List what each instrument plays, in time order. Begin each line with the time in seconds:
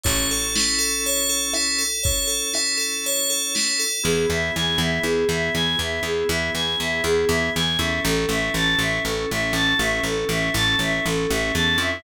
0.04 electric bass (finger) A1, drawbar organ C#4 E4 A4, tubular bells C#5, kick, closed hi-hat
0.30 tubular bells A4, closed hi-hat
0.55 tubular bells E4, snare
0.79 tubular bells A4, closed hi-hat
1.04 tubular bells C#5, closed hi-hat
1.29 tubular bells A4, closed hi-hat
1.54 tubular bells E4, cross-stick
1.78 tubular bells A4, closed hi-hat
2.03 drawbar organ C#4 E4 A4, tubular bells C#5, kick, closed hi-hat
2.27 tubular bells A4, closed hi-hat
2.54 tubular bells E4, cross-stick
2.77 tubular bells A4, closed hi-hat
3.04 tubular bells C#5, closed hi-hat
3.29 tubular bells A4, closed hi-hat
3.55 tubular bells E4, snare
3.79 tubular bells A4, closed hi-hat
4.03 electric bass (finger) E2, drawbar organ B3 E4 G#4, choir aahs G#4
4.29 electric bass (finger) E2, choir aahs E5
4.56 electric bass (finger) E2, choir aahs G#5
4.78 electric bass (finger) E2, choir aahs E5
5.03 electric bass (finger) E2, choir aahs G#4
5.29 electric bass (finger) E2, choir aahs E5
5.55 electric bass (finger) E2, choir aahs G#5
5.79 electric bass (finger) E2, choir aahs E5
6.03 electric bass (finger) E2, choir aahs G#4
6.28 electric bass (finger) E2, choir aahs E5
6.54 electric bass (finger) E2, choir aahs G#5
6.80 electric bass (finger) E2, choir aahs E5
7.04 electric bass (finger) E2, choir aahs G#4
7.28 electric bass (finger) E2, choir aahs E5
7.55 electric bass (finger) E2, choir aahs G#5
7.78 electric bass (finger) E2, drawbar organ C#4 E4 A4, choir aahs E5
8.04 electric bass (finger) A1, choir aahs A4
8.29 electric bass (finger) A1, choir aahs E5
8.54 electric bass (finger) A1, choir aahs A5
8.79 electric bass (finger) A1, choir aahs E5
9.04 electric bass (finger) A1, choir aahs A4
9.30 electric bass (finger) A1, choir aahs E5
9.53 electric bass (finger) A1, choir aahs A5
9.79 electric bass (finger) A1, choir aahs E5
10.03 electric bass (finger) A1, choir aahs A4
10.29 electric bass (finger) A1, choir aahs E5
10.54 electric bass (finger) A1, choir aahs A5
10.79 electric bass (finger) A1, choir aahs E5
11.05 electric bass (finger) A1, choir aahs A4
11.30 electric bass (finger) A1, choir aahs E5
11.54 electric bass (finger) E2, choir aahs A5
11.78 electric bass (finger) F2, choir aahs E5